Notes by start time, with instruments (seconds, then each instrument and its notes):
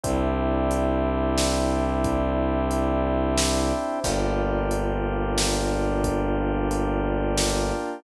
0.03 violin C2, drawbar organ C4 D4 E4 G4, kick, closed hi-hat
0.71 closed hi-hat
1.38 snare
2.04 kick, closed hi-hat
2.71 closed hi-hat
3.38 snare
4.04 violin G1, drawbar organ A#3 D4 F4 G4, kick, crash
4.71 closed hi-hat
5.38 snare
6.04 kick, closed hi-hat
6.71 closed hi-hat
7.38 snare